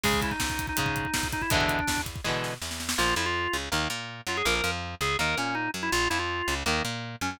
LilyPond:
<<
  \new Staff \with { instrumentName = "Drawbar Organ" } { \time 4/4 \key a \major \tempo 4 = 163 gis'8 e'16 dis'4 dis'4.~ dis'16 dis'16 e'16 | d'4. r2 r8 | \key bes \major f'8 e'16 f'4 r4. r16 f'16 aes'16 | bes'16 bes'8 r8. aes'8 bes'8 des'8 ees'8 r16 e'16 |
f'8 e'16 f'4 r4. r16 des'16 des'16 | }
  \new Staff \with { instrumentName = "Overdriven Guitar" } { \time 4/4 \key a \major <cis gis>2 <cis gis>2 | <b, d e gis>2 <b, d e gis>2 | \key bes \major <f bes>8 f4 des8 <ees bes>8 bes4 ges8 | <f bes>8 f4 des8 <ees bes>8 bes4 ges8 |
r8 f4 des8 <ees bes>8 bes4 ges8 | }
  \new Staff \with { instrumentName = "Electric Bass (finger)" } { \clef bass \time 4/4 \key a \major cis,4 cis,4 gis,4 cis,4 | e,4 e,4 b,4 e,4 | \key bes \major bes,,8 f,4 des,8 ees,8 bes,4 ges,8 | bes,,8 f,4 des,8 ees,8 bes,4 ges,8 |
bes,,8 f,4 des,8 ees,8 bes,4 ges,8 | }
  \new DrumStaff \with { instrumentName = "Drums" } \drummode { \time 4/4 <cymc bd>16 bd16 <hh bd>16 bd16 <bd sn>16 bd16 <hh bd>16 bd16 <hh bd>16 bd16 <hh bd>16 bd16 <bd sn>16 bd16 <hh bd>16 bd16 | <hh bd>16 bd16 <hh bd>16 bd16 <bd sn>16 bd16 <hh bd>16 bd16 <bd sn>8 sn8 sn16 sn16 sn16 sn16 | r4 r4 r4 r4 | r4 r4 r4 r4 |
r4 r4 r4 r4 | }
>>